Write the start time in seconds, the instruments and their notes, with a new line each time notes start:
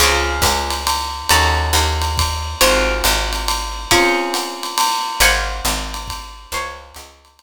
0.00 electric bass (finger) C#2, acoustic guitar (steel) C4 C#4 F4 G#4, ride
0.42 electric bass (finger) C#2, kick, hi-hat pedal, ride
0.70 ride
0.87 ride
1.29 electric bass (finger) D#2, acoustic guitar (steel) C#4 D#4 F#4 A4, ride
1.73 electric bass (finger) D#2, hi-hat pedal, ride
2.02 ride
2.18 kick, ride
2.61 electric bass (finger) G#1, acoustic guitar (steel) C4 F4 F#4 G#4, ride
3.04 electric bass (finger) G#1, hi-hat pedal, ride
3.33 ride
3.48 ride
3.91 acoustic guitar (steel) C4 C#4 F4 G#4, kick, ride
4.34 hi-hat pedal, ride
4.63 ride
4.78 ride
5.20 electric bass (finger) G#1, acoustic guitar (steel) C5 F5 F#5 G#5, ride
5.65 electric bass (finger) G#1, hi-hat pedal, ride
5.94 ride
6.08 kick, ride
6.52 electric bass (finger) C#2, acoustic guitar (steel) C5 C#5 F5 G#5, ride
6.94 electric bass (finger) C#2, hi-hat pedal, ride
7.25 ride
7.39 ride